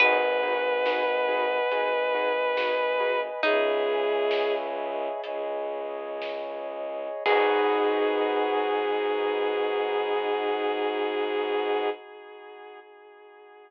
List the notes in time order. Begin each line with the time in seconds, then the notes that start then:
0.00 G#1 D#4 F#4 G#4 B4 D#5 F#5 G#5, kick, crash
0.43 D#4 F#4 G#4 B4
0.86 D#4 F#4 G#4 B4, snare
1.28 D#4 F#4 G#4 B4
1.70 G#1 D#4 F#4 G#4 B4 D#5 G#5 B5, closed hi-hat
2.14 D#4 F#4 G#4 B4
2.57 D#4 F#4 G#4 B4, snare
3.00 D#4 F#4 G#4 B4
3.43 C#2 D#4 G#4 C#5 D#5 E5 G#5, kick, closed hi-hat
4.31 snare
5.23 C#2 G#4 C#5 D#5 G#5, closed hi-hat
6.22 snare
7.25 G#2 B3 D#4 F#4 G#4 B4, kick, crash